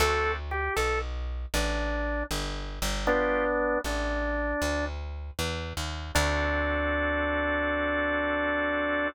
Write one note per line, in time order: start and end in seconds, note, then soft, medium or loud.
0.00 0.69 D2 medium
0.00 0.36 C4 medium
0.00 0.36 D4 loud
0.00 0.36 F#4 loud
0.00 0.32 A4 loud
0.00 0.36 A4 loud
0.51 0.74 G4 medium
0.76 1.46 B1 medium
0.76 0.99 A4 medium
1.54 2.23 A1 medium
1.54 2.24 D4 medium
2.31 2.79 G1 medium
2.82 3.77 G1 medium
3.07 3.79 B3 loud
3.07 3.44 B3 loud
3.07 3.79 D4 loud
3.07 3.44 D4 loud
3.07 3.44 F4 loud
3.07 3.44 G4 loud
3.84 4.54 A1 medium
3.84 4.85 D4 medium
4.62 5.31 D2 medium
5.39 5.73 E2 medium
5.77 6.12 D#2 medium
6.15 9.08 D2 loud
6.15 9.08 C4 medium
6.15 9.08 D4 loud
6.15 9.08 F#4 loud
6.15 9.08 A4 loud